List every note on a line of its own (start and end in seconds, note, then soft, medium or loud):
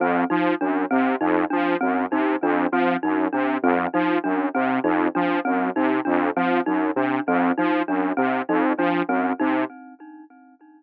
0.00 0.24 F2 medium
0.00 0.26 C4 medium
0.30 0.55 F3 medium
0.30 0.54 D#4 medium
0.61 0.85 F#2 medium
0.61 0.85 D4 medium
0.91 1.16 C3 medium
0.91 1.15 C4 medium
1.21 1.45 F2 medium
1.21 1.45 D#4 medium
1.50 1.77 F3 medium
1.50 1.74 D4 medium
1.81 2.06 F#2 medium
1.81 2.05 C4 medium
2.12 2.36 C3 medium
2.12 2.36 D#4 medium
2.42 2.67 F2 medium
2.42 2.67 D4 medium
2.72 2.96 F3 medium
2.72 2.97 C4 medium
3.03 3.28 F#2 medium
3.03 3.27 D#4 medium
3.33 3.58 C3 medium
3.33 3.57 D4 medium
3.63 3.87 F2 medium
3.63 3.88 C4 medium
3.94 4.18 F3 medium
3.94 4.18 D#4 medium
4.24 4.49 F#2 medium
4.24 4.48 D4 medium
4.55 4.80 C3 medium
4.55 4.79 C4 medium
4.84 5.08 F2 medium
4.84 5.08 D#4 medium
5.15 5.40 F3 medium
5.15 5.39 D4 medium
5.45 5.71 F#2 medium
5.45 5.69 C4 medium
5.76 6.01 C3 medium
5.76 6.00 D#4 medium
6.05 6.31 F2 medium
6.05 6.29 D4 medium
6.36 6.61 F3 medium
6.36 6.61 C4 medium
6.66 6.91 F#2 medium
6.66 6.91 D#4 medium
6.96 7.20 C3 medium
6.96 7.21 D4 medium
7.28 7.52 F2 medium
7.28 7.52 C4 medium
7.58 7.83 F3 medium
7.58 7.82 D#4 medium
7.88 8.13 F#2 medium
7.88 8.12 D4 medium
8.17 8.42 C3 medium
8.17 8.41 C4 medium
8.49 8.73 F2 medium
8.49 8.73 D#4 medium
8.78 9.02 F3 medium
8.78 9.03 D4 medium
9.08 9.33 F#2 medium
9.08 9.33 C4 medium
9.40 9.65 C3 medium
9.40 9.64 D#4 medium